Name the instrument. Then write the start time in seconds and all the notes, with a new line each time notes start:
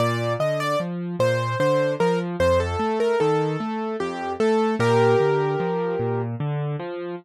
acoustic grand piano
0.00 A#2 D5
0.40 D3 D#5
0.60 D5
0.80 F3
1.20 A#2 C5
1.60 D3 C5
2.00 F3 A#4
2.40 F2 C5
2.60 A4
2.79 A3
3.00 A#4
3.20 D#3 A4
3.60 A3
4.00 F2 G4
4.40 A3 A4
4.79 A#2 G4 A#4
5.20 D3
5.60 F3
6.00 A#2
6.40 D3
6.80 F3